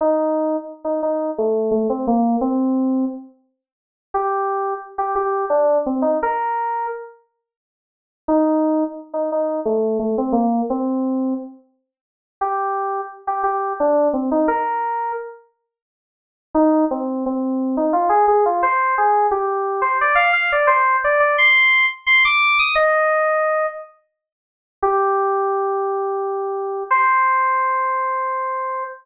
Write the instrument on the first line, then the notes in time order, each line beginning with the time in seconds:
electric piano 2
0.01 D#4
0.84 D#4
1.03 D#4
1.38 A3
1.71 A3
1.90 C4
2.07 A#3
2.41 C4
4.14 G4
4.98 G4
5.15 G4
5.50 D4
5.86 C4
6.02 D#4
6.23 A#4
8.28 D#4
9.14 D#4
9.32 D#4
9.65 A3
9.99 A3
10.18 C4
10.32 A#3
10.70 C4
12.41 G4
13.27 G4
13.43 G4
13.80 D4
14.13 C4
14.31 D#4
14.48 A#4
16.54 D#4
16.91 C4
17.26 C4
17.77 D#4
17.93 F4
18.09 G#4
18.28 G#4
18.46 F4
18.63 C5
18.98 G#4
19.31 G4
19.82 C5
20.01 D5
20.15 F5
20.33 F5
20.52 D5
20.67 C5
21.04 D5
21.20 D5
21.38 C6
22.06 C6
22.25 D6
22.59 D#6
22.75 D#5
24.82 G4
26.91 C5